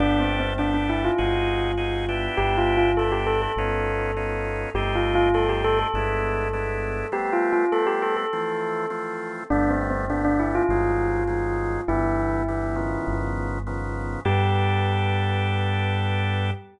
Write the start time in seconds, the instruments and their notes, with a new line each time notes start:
0.00 synth bass 1 G1, drawbar organ B3 D4 G4 A4, tubular bells D4
0.20 tubular bells C4
0.40 tubular bells C4
0.58 drawbar organ B3 D4 G4 A4, tubular bells D4
0.74 tubular bells D4
0.89 tubular bells E4
1.04 tubular bells F4
1.18 synth bass 1 G1, drawbar organ C4 D#4 F#4 G#4
1.77 drawbar organ C4 D#4 F#4 G#4
2.09 drawbar organ B3 D4 E4 G4
2.37 synth bass 1 G1, tubular bells G4
2.57 tubular bells F4
2.77 tubular bells F4
2.97 drawbar organ B3 D4 E4 G4, tubular bells A4
3.12 tubular bells G4
3.27 tubular bells A4
3.42 tubular bells A4
3.56 synth bass 1 G1, drawbar organ B3 C#4 D#4 F4
4.17 drawbar organ B3 C#4 D#4 F4
4.74 synth bass 1 G1, drawbar organ A3 C4 D#4 G4, tubular bells G4
4.95 tubular bells F4
5.15 tubular bells F4
5.34 drawbar organ A3 C4 D#4 G4, tubular bells A4
5.49 tubular bells G4
5.64 tubular bells A4
5.79 tubular bells A4
5.94 synth bass 1 G1, drawbar organ G#3 B3 D4 E4
6.53 drawbar organ G#3 B3 D4 E4
7.12 drawbar organ G3 A3 B3 C4, tubular bells G4
7.33 tubular bells F4
7.53 tubular bells F4
7.72 drawbar organ G3 A3 B3 C4, tubular bells A4
7.87 tubular bells G4
8.02 tubular bells A4
8.17 tubular bells A4
8.33 drawbar organ E3 F3 A3 C4
8.90 drawbar organ E3 F3 A3 C4
9.50 synth bass 1 G1, drawbar organ D3 G3 A3 B3, tubular bells D4
9.71 tubular bells C4
9.90 tubular bells C4
10.10 drawbar organ D3 G3 A3 B3, tubular bells D4
10.25 tubular bells D4
10.39 tubular bells E4
10.55 tubular bells F4
10.69 synth bass 1 G1, drawbar organ D#3 F#3 G#3 C4
11.27 drawbar organ D#3 F#3 G#3 C4
11.88 synth bass 1 G1, drawbar organ D3 E3 G3 B3, tubular bells E4
12.48 drawbar organ D3 E3 G3 B3
12.76 drawbar organ C#3 D#3 F3 B3
13.07 synth bass 1 G1
13.67 drawbar organ C#3 D#3 F3 B3
14.25 synth bass 1 G2, drawbar organ B3 D4 G4 A4, tubular bells G4